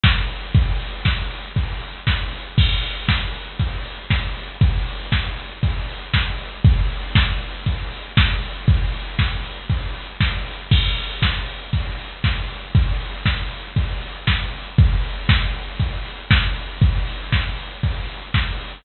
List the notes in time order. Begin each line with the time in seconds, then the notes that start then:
0.03 kick, snare
0.29 open hi-hat
0.55 kick, closed hi-hat
0.80 open hi-hat
1.05 kick, snare
1.31 open hi-hat
1.56 kick, closed hi-hat
1.81 open hi-hat
2.07 kick, snare
2.32 open hi-hat
2.58 kick, crash
2.83 open hi-hat
3.08 kick, snare
3.34 open hi-hat
3.59 kick, closed hi-hat
3.85 open hi-hat
4.10 kick, snare
4.36 open hi-hat
4.61 kick, closed hi-hat
4.87 open hi-hat
5.12 kick, snare
5.37 open hi-hat
5.63 kick, closed hi-hat
5.89 open hi-hat
6.14 kick, snare
6.39 open hi-hat
6.65 kick, closed hi-hat
6.90 open hi-hat
7.15 kick, snare
7.41 open hi-hat
7.66 kick, closed hi-hat
7.92 open hi-hat
8.17 kick, snare
8.43 open hi-hat
8.68 kick, closed hi-hat
8.94 open hi-hat
9.19 kick, snare
9.44 open hi-hat
9.70 kick, closed hi-hat
9.95 open hi-hat
10.20 kick, snare
10.46 open hi-hat
10.71 kick, crash
10.97 open hi-hat
11.22 kick, snare
11.48 open hi-hat
11.73 kick, closed hi-hat
11.99 open hi-hat
12.24 kick, snare
12.50 open hi-hat
12.75 kick, closed hi-hat
13.00 open hi-hat
13.26 kick, snare
13.51 open hi-hat
13.76 kick, closed hi-hat
14.02 open hi-hat
14.27 kick, snare
14.53 open hi-hat
14.78 kick, closed hi-hat
15.04 open hi-hat
15.29 kick, snare
15.54 open hi-hat
15.80 kick, closed hi-hat
16.05 open hi-hat
16.31 kick, snare
16.56 open hi-hat
16.82 kick, closed hi-hat
17.07 open hi-hat
17.32 kick, snare
17.58 open hi-hat
17.83 kick, closed hi-hat
18.08 open hi-hat
18.34 kick, snare
18.60 open hi-hat